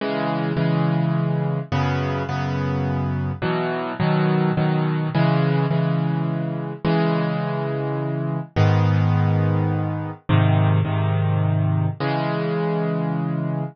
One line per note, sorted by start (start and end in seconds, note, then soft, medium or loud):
0.01 0.53 C#3 loud
0.01 0.53 E3 loud
0.01 0.53 G#3 loud
0.57 1.59 C#3 medium
0.57 1.59 E3 medium
0.57 1.59 G#3 medium
1.72 2.23 F#2 loud
1.72 2.23 C#3 loud
1.72 2.23 B3 loud
2.29 3.32 F#2 medium
2.29 3.32 C#3 medium
2.29 3.32 B3 medium
3.42 3.93 B2 loud
3.42 3.93 E3 loud
3.42 3.93 F#3 medium
4.00 4.51 B2 loud
4.00 4.51 D#3 medium
4.00 4.51 F#3 loud
4.57 5.09 B2 medium
4.57 5.09 D#3 medium
4.57 5.09 F#3 medium
5.15 5.66 C#3 loud
5.15 5.66 E3 loud
5.15 5.66 G#3 loud
5.70 6.73 C#3 medium
5.70 6.73 E3 medium
5.70 6.73 G#3 medium
6.85 8.39 C#3 medium
6.85 8.39 E3 loud
6.85 8.39 G#3 loud
8.56 10.11 G#2 loud
8.56 10.11 D#3 loud
8.56 10.11 B3 loud
10.29 10.81 G#2 loud
10.29 10.81 C3 loud
10.29 10.81 D#3 loud
10.85 11.88 G#2 medium
10.85 11.88 C3 medium
10.85 11.88 D#3 loud
12.00 13.64 C#3 loud
12.00 13.64 E3 medium
12.00 13.64 G#3 loud